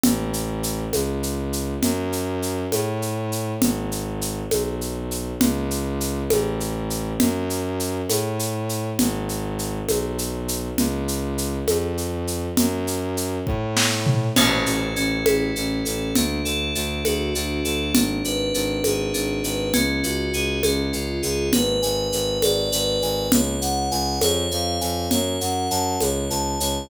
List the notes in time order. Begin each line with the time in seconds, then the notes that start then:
0.03 A1, low conga, shaker
0.33 shaker
0.63 shaker
0.93 C#2, high conga, shaker
1.23 shaker
1.53 shaker
1.82 F#2, low conga, shaker
2.12 shaker
2.42 shaker
2.72 A2, high conga, shaker
3.02 shaker
3.32 shaker
3.61 G#1, low conga, shaker
3.92 shaker
4.21 shaker
4.51 B1, high conga, shaker
4.81 shaker
5.11 shaker
5.40 C#2, low conga, shaker
5.71 shaker
6.00 shaker
6.30 A1, high conga, shaker
6.60 shaker
6.90 shaker
7.20 F#2, low conga, shaker
7.50 shaker
7.80 shaker
8.09 A2, high conga, shaker
8.39 shaker
8.69 shaker
8.99 G#1, low conga, shaker
9.29 shaker
9.59 shaker
9.88 B1, high conga, shaker
10.18 shaker
10.48 shaker
10.78 C#2, low conga, shaker
11.08 shaker
11.38 shaker
11.67 F2, high conga, shaker
11.98 shaker
12.27 shaker
12.57 F#2, low conga, shaker
12.87 shaker
13.17 shaker
13.47 A2, kick
13.77 snare
14.06 floor tom
14.36 A1 C#4, crash, low conga, shaker
14.66 A1 A4, shaker
14.96 A1 C#4, shaker
15.26 A1 E4, high conga, shaker
15.56 A1 C#4, shaker
15.85 A1 A4, shaker
16.15 D2 D4, low conga, shaker
16.45 D2 A4, shaker
16.75 D2 D4, shaker
17.05 D2 F#4, high conga, shaker
17.34 D2 D4, shaker
17.65 D2 A4, shaker
17.94 G#1 D4, low conga, shaker
18.24 G#1 B4, shaker
18.54 G#1 D4, shaker
18.84 G#1 G#4, high conga, shaker
19.14 G#1 D4, shaker
19.44 G#1 B4, shaker
19.74 C#2 C#4, low conga, shaker
20.03 C#2 F#4, shaker
20.33 C#2 G#4, shaker
20.63 C#2 C#4, high conga, shaker
20.93 C#2 F4, shaker
21.23 C#2 G#4, shaker
21.52 G#1 B4, low conga, shaker
21.82 G#1 G#5, shaker
22.12 G#1 B4, shaker
22.42 G#1 D5, high conga, shaker
22.72 G#1 B4, shaker
23.02 G#1 G#5, shaker
23.31 C#2 C#5, low conga, shaker
23.61 C#2 F#5, shaker
23.91 C#2 G#5, shaker
24.21 F2 C#5, high conga, shaker
24.51 F2 F5, shaker
24.81 F2 G#5, shaker
25.11 F#2 C#5, low conga, shaker
25.41 F#2 F#5, shaker
25.70 F#2 A5, shaker
26.00 C#2 C#5, high conga, shaker
26.30 C#2 A5, shaker
26.60 C#2 C#5, shaker